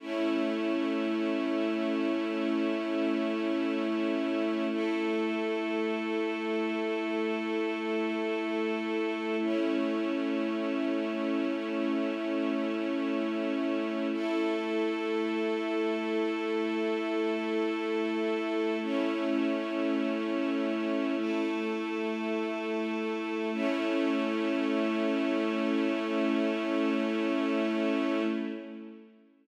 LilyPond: \new Staff { \time 4/4 \key a \mixolydian \tempo 4 = 51 <a cis' e'>1 | <a e' a'>1 | <a cis' e'>1 | <a e' a'>1 |
<a cis' e'>2 <a e' a'>2 | <a cis' e'>1 | }